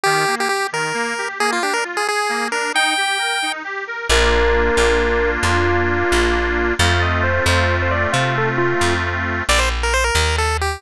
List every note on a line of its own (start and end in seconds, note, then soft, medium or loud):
0.03 0.25 D#3 medium
0.03 0.35 G4 loud
0.27 0.47 A#3 medium
0.40 0.49 G4 medium
0.49 0.67 G4 medium
0.49 0.70 G4 medium
0.72 0.92 D#3 medium
0.72 1.29 A#4 medium
0.94 1.14 A#3 medium
1.18 1.38 G4 medium
1.39 1.59 A#3 medium
1.39 1.51 G#4 loud
1.52 1.63 F4 medium
1.62 1.82 D4 medium
1.62 1.74 G4 medium
1.74 1.84 A#4 medium
1.84 2.04 F4 medium
1.97 2.07 G#4 medium
2.07 2.28 G#4 medium
2.07 2.48 G#4 medium
2.29 2.49 A#3 medium
2.51 2.71 D4 medium
2.51 2.72 A#4 medium
2.74 2.94 D#4 medium
2.74 3.52 G5 loud
2.97 3.17 G4 medium
3.18 3.39 A#4 medium
3.42 3.62 D#4 medium
3.64 3.84 G4 medium
3.87 4.07 A#4 medium
4.09 4.70 A#1 medium
4.09 6.74 A#3 medium
4.09 6.74 D4 medium
4.09 6.74 F4 medium
4.09 5.30 A#4 loud
4.77 5.38 A#1 medium
5.43 6.04 F2 medium
5.43 6.73 F4 medium
6.12 6.73 A#1 medium
6.79 7.40 F2 medium
6.79 9.43 A3 medium
6.79 9.43 C4 medium
6.79 9.43 F4 medium
6.79 7.01 F5 medium
7.02 7.22 D#5 medium
7.23 7.44 C5 medium
7.46 8.07 F2 medium
7.46 7.75 C5 medium
7.82 7.93 C5 medium
7.91 8.10 D5 medium
8.12 8.74 C3 medium
8.12 8.34 F4 loud
8.38 8.49 A4 medium
8.58 8.94 F4 medium
8.81 9.42 F2 medium
9.49 10.11 A#1 medium
9.49 9.60 D5 loud
9.59 9.69 C5 medium
9.83 9.94 A#4 medium
9.94 10.04 C5 loud
10.04 10.36 A#4 medium
10.15 10.77 D#2 medium
10.38 10.57 A4 medium
10.61 10.82 G4 medium